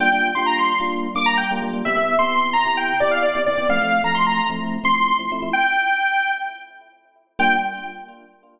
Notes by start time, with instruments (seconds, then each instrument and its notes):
0.00 electric piano 1 G3 A#3 D4 F4, lead 2 (sawtooth) G5
0.12 electric piano 1 G3 A#3 D4 F4
0.35 electric piano 1 G3 A#3 D4 F4, lead 2 (sawtooth) C6
0.46 lead 2 (sawtooth) A#5
0.59 lead 2 (sawtooth) C6
0.80 electric piano 1 G3 A#3 D4 F4
1.15 electric piano 1 G3 A#3 D4 F4, lead 2 (sawtooth) D6
1.26 lead 2 (sawtooth) A#5
1.37 lead 2 (sawtooth) G5
1.51 electric piano 1 G3 A#3 D4 F4
1.62 electric piano 1 G3 A#3 D4 F4
1.73 electric piano 1 G3 A#3 D4 F4
1.85 electric piano 1 C3 B3 E4 G4, lead 2 (sawtooth) E5
1.96 electric piano 1 C3 B3 E4 G4
2.19 electric piano 1 C3 B3 E4 G4, lead 2 (sawtooth) C6
2.53 lead 2 (sawtooth) A#5
2.65 electric piano 1 C3 B3 E4 G4
2.77 lead 2 (sawtooth) G5
3.00 electric piano 1 C3 B3 E4 G4, lead 2 (sawtooth) D5
3.11 lead 2 (sawtooth) F5
3.22 lead 2 (sawtooth) D5
3.35 electric piano 1 C3 B3 E4 G4
3.46 electric piano 1 C3 B3 E4 G4, lead 2 (sawtooth) D5
3.57 electric piano 1 C3 B3 E4 G4
3.69 electric piano 1 F3 A3 C4 E4, lead 2 (sawtooth) F5
3.81 electric piano 1 F3 A3 C4 E4
4.04 electric piano 1 F3 A3 C4 E4, lead 2 (sawtooth) A#5
4.15 lead 2 (sawtooth) C6
4.27 lead 2 (sawtooth) A#5
4.50 electric piano 1 F3 A3 C4 E4
4.84 electric piano 1 F3 A3 C4 E4, lead 2 (sawtooth) C6
4.96 lead 2 (sawtooth) C6
5.08 lead 2 (sawtooth) C6
5.19 electric piano 1 F3 A3 C4 E4
5.32 electric piano 1 F3 A3 C4 E4
5.42 electric piano 1 F3 A3 C4 E4
5.53 lead 2 (sawtooth) G5
7.39 electric piano 1 G3 A#3 D4 F4, lead 2 (sawtooth) G5